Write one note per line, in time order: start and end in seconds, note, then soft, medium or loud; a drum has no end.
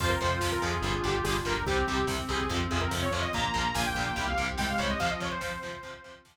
0.00 0.16 F2 loud
0.00 0.09 C3 medium
0.00 0.09 F3 loud
0.00 0.83 C4 medium
0.00 0.83 F4 medium
0.00 1.55 F4 loud
0.00 0.10 C5 loud
0.00 kick loud
0.00 crash medium
0.09 0.19 A#4 medium
0.09 kick medium
0.21 0.40 F2 loud
0.21 0.29 C3 medium
0.21 0.29 F3 medium
0.21 0.39 C5 medium
0.21 kick medium
0.21 closed hi-hat medium
0.32 kick medium
0.41 0.58 F2 medium
0.41 0.49 C3 medium
0.41 0.49 F3 medium
0.41 kick medium
0.41 snare loud
0.52 0.62 A#4 medium
0.52 kick medium
0.62 0.80 F2 medium
0.62 0.70 C3 medium
0.62 0.70 F3 medium
0.62 1.02 G#4 medium
0.62 kick medium
0.62 closed hi-hat medium
0.74 kick medium
0.82 1.00 G1 loud
0.82 0.91 D3 medium
0.82 0.91 G3 medium
0.82 1.66 D4 medium
0.82 1.66 G4 medium
0.82 kick medium
0.82 closed hi-hat medium
0.94 kick medium
1.04 1.21 G1 loud
1.04 1.12 D3 medium
1.04 1.12 G3 medium
1.04 1.14 G4 loud
1.04 kick medium
1.04 closed hi-hat medium
1.14 1.24 G4 medium
1.14 kick medium
1.24 1.42 G1 loud
1.24 1.34 D3 medium
1.24 1.34 G3 medium
1.24 1.34 G#4 loud
1.24 kick medium
1.24 snare loud
1.36 kick medium
1.45 1.63 G1 loud
1.45 1.53 D3 medium
1.45 1.53 G3 medium
1.45 1.64 A#4 loud
1.45 kick medium
1.45 closed hi-hat medium
1.56 kick medium
1.65 1.83 C2 loud
1.65 1.76 C3 medium
1.65 1.76 G3 medium
1.65 3.11 C4 medium
1.65 2.49 C4 medium
1.65 2.49 G4 medium
1.65 2.06 G4 loud
1.65 kick medium
1.65 closed hi-hat medium
1.77 kick medium
1.87 2.05 C2 medium
1.87 1.96 C3 medium
1.87 1.96 G3 medium
1.87 kick medium
1.87 closed hi-hat medium
1.98 kick medium
2.07 2.25 C2 loud
2.07 2.16 C3 medium
2.07 2.16 G3 medium
2.07 kick medium
2.07 snare medium
2.18 kick medium
2.29 2.47 C2 medium
2.29 2.37 C3 medium
2.29 2.37 G3 medium
2.29 2.49 G#4 loud
2.29 kick medium
2.29 closed hi-hat medium
2.40 kick medium
2.49 2.68 F2 loud
2.49 2.58 C3 medium
2.49 2.58 F3 medium
2.49 3.32 C4 medium
2.49 3.32 F4 medium
2.49 kick medium
2.49 closed hi-hat medium
2.60 kick medium
2.71 2.89 F2 loud
2.71 2.79 C3 medium
2.71 2.79 F3 medium
2.71 2.81 G#4 loud
2.71 kick medium
2.71 closed hi-hat medium
2.81 2.91 A#4 medium
2.81 kick medium
2.91 3.09 F2 loud
2.91 3.00 C3 medium
2.91 3.00 F3 medium
2.91 kick medium
2.91 snare medium
3.02 3.12 C#5 loud
3.02 kick medium
3.11 3.28 F2 loud
3.11 3.21 C3 medium
3.11 3.21 F3 medium
3.11 3.23 C#5 medium
3.11 kick medium
3.11 closed hi-hat medium
3.22 3.32 D#5 loud
3.22 kick medium
3.32 3.52 A#1 loud
3.32 3.43 A#2 medium
3.32 3.43 F3 medium
3.32 4.35 A#3 medium
3.32 4.15 A#3 medium
3.32 4.15 F4 medium
3.32 3.74 A#5 loud
3.32 kick medium
3.32 closed hi-hat medium
3.44 kick medium
3.54 3.73 A#1 medium
3.54 3.62 A#2 medium
3.54 3.62 F3 medium
3.54 kick medium
3.54 closed hi-hat medium
3.64 kick medium
3.74 3.93 A#1 loud
3.74 3.83 A#2 medium
3.74 3.83 F3 medium
3.74 3.85 G#5 loud
3.74 kick medium
3.74 snare loud
3.86 4.04 G5 medium
3.86 kick medium
3.95 4.12 A#1 loud
3.95 4.04 A#2 medium
3.95 4.04 F3 medium
3.95 kick medium
3.95 closed hi-hat medium
4.06 4.26 G5 medium
4.06 kick medium
4.16 4.35 C2 loud
4.16 4.24 C3 medium
4.16 4.24 G3 medium
4.16 4.99 C4 medium
4.16 4.99 G4 medium
4.16 kick medium
4.16 closed hi-hat medium
4.27 4.46 F5 medium
4.27 kick medium
4.38 4.56 C2 medium
4.38 4.46 C3 medium
4.38 4.46 G3 medium
4.38 kick medium
4.38 closed hi-hat medium
4.48 kick medium
4.58 4.76 C2 medium
4.58 4.66 C3 medium
4.58 4.66 G3 medium
4.58 4.96 G#3 medium
4.58 4.68 G5 medium
4.58 kick medium
4.58 snare medium
4.69 4.80 F5 medium
4.69 kick medium
4.78 4.97 C2 loud
4.78 4.86 C3 medium
4.78 4.86 G3 medium
4.78 4.89 C#5 medium
4.78 kick medium
4.78 closed hi-hat medium
4.89 4.99 D#5 medium
4.89 kick medium
4.98 5.08 C3 medium
4.98 5.68 F3 medium
4.98 5.08 F3 medium
4.98 5.82 C4 medium
4.98 5.82 F4 medium
4.98 5.10 F5 loud
4.98 kick medium
4.98 closed hi-hat medium
5.10 5.20 D#5 medium
5.10 kick medium
5.20 5.29 C3 medium
5.20 5.29 F3 medium
5.20 5.31 C#5 loud
5.20 kick medium
5.20 closed hi-hat medium
5.31 6.16 C5 loud
5.31 kick medium
5.41 5.49 C3 medium
5.41 5.49 F3 medium
5.41 kick medium
5.41 snare medium
5.52 kick medium
5.62 5.71 C3 medium
5.62 5.71 F3 medium
5.62 kick medium
5.62 closed hi-hat medium
5.73 kick medium
5.83 5.92 C3 medium
5.83 5.92 F3 medium
5.83 6.37 C4 medium
5.83 6.37 F4 medium
5.83 kick medium
5.83 closed hi-hat medium
5.94 kick medium
6.04 6.13 C3 medium
6.04 6.13 F3 medium
6.04 kick medium
6.04 closed hi-hat medium
6.14 kick medium
6.25 6.33 C3 medium
6.25 6.33 F3 medium
6.25 kick medium
6.25 snare loud
6.36 kick medium